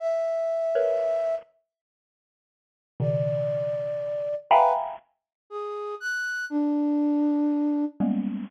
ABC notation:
X:1
M:3/4
L:1/16
Q:1/4=60
K:none
V:1 name="Xylophone"
z3 [^AB^c]3 z6 | [B,,^C,^D,]6 [efg^g^ab]2 z4 | z8 [G,^G,^A,B,^C]2 z2 |]
V:2 name="Flute"
e6 z6 | d6 B z3 ^G2 | ^f'2 D6 z4 |]